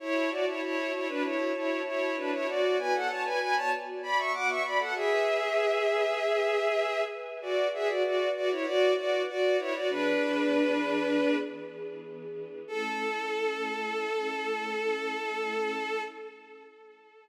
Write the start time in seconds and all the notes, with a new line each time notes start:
0.00 E4 F#4 C#5 A5
0.31 F#4 D5
0.46 E4 C#5
0.62 E4 C#5
0.93 E4 C#5
1.08 D4 B4
1.23 E4 C#5
1.55 E4 C#5
1.86 E4 C#5
2.17 D4 B4
2.32 E4 C#5
2.47 B3 F#4 D5
2.79 B4 G#5
2.94 A4 F#5
3.09 C#5 A5
3.25 B4 G#5
3.40 B4 G#5
3.56 C#5 A5
4.03 D5 B5
4.18 E5 C#6
4.33 F#5 D6
4.48 E5 C#6
4.64 D5 B5
4.79 A4 F#5
4.95 G#4 B4 E5 G#5
7.42 F#4 B4 D5 F#5
7.73 G#4 E5
7.88 F#4 D5
8.04 F#4 D5
8.35 F#4 D5
8.51 E4 C#5
8.66 F#4 D5
8.97 F#4 D5
9.28 F#4 D5
9.59 E4 C#5
9.74 F#4 D5
9.89 E3 B3 D4 G#4 B4
12.67 A3 C#4 E4 A4